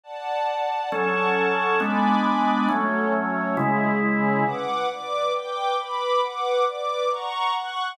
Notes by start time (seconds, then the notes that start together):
0.03 D5 F#5 A5
0.92 F#3 C#4 A4 F#5 A5 C#6
1.80 G#3 B3 D4 G#5 B5 D6
2.69 F#3 A3 C#4 F#4 A4 C#5
3.13 C#4 F#4 C#5
3.56 C#3 G#3 C#4 E4 G#4
4.01 G#3 C#4 G#4
4.46 B4 F#5 D6
4.88 B4 D5 D6
5.34 B4 G5 D6
5.77 B4 B5 D6
6.21 B4 F#5 D6
6.65 B4 D5 D6
7.10 F#5 A#5 C#6
7.54 F#5 C#6 F#6